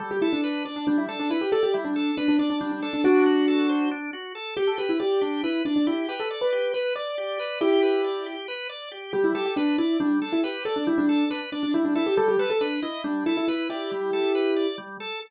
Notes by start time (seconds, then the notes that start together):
0.00 G3 A4
0.11 G4
0.22 E4 A4
0.33 D4
0.44 B4
0.65 D4 D5
0.76 D4
0.87 G3 D4
0.98 E4
1.09 D4 A4
1.20 D4
1.30 E4 B4
1.41 G4
1.52 A4 D5
1.63 G4
1.74 G3 E4
1.85 D4
1.96 A4
2.17 D4 B4
2.28 D4
2.39 D4 D5
2.50 D4
2.61 G3 D4
2.72 D4
2.82 D4 A4
2.93 D4
3.04 D4 F#4
3.26 F#4
3.48 A4
3.69 C5
3.91 D4
4.13 F#4
4.35 A4
4.57 G4
4.67 A4
4.78 G4 B4
4.89 E4
4.99 G4 D5
5.21 D4 G4
5.44 E4 B4
5.65 D4 D5
5.76 D4
5.87 E4 G4
6.09 G4 B4
6.20 A4
6.30 D5
6.41 B4
6.52 G4
6.74 B4
6.96 D5
7.18 G4
7.39 B4
7.61 E4 G4
7.83 B4
8.04 D5
8.26 G4
8.48 B4
8.69 D5
8.91 G4
9.13 G3 G4
9.24 E4
9.35 G4 A4
9.46 G4
9.56 D4 B4
9.78 E4 D5
10.00 G3 D4
10.22 D4 A4
10.33 E4
10.43 G4 B4
10.65 A4 D5
10.76 D4
10.87 G3 E4
10.98 D4
11.09 A4
11.30 D4 B4
11.52 D4 D5
11.63 D4
11.74 G3 E4
11.85 D4
11.95 E4 A4
12.07 G4
12.17 G3 A4
12.28 G4
12.39 A4 B4
12.50 A4
12.61 D4 B4
12.82 E4 D#5
13.04 G3 D4
13.26 E4 A4
13.37 E4
13.48 E4 B4
13.70 E4 G4 D5
13.91 G3
14.13 A4
14.35 B4
14.56 D5
14.78 G3
15.00 A4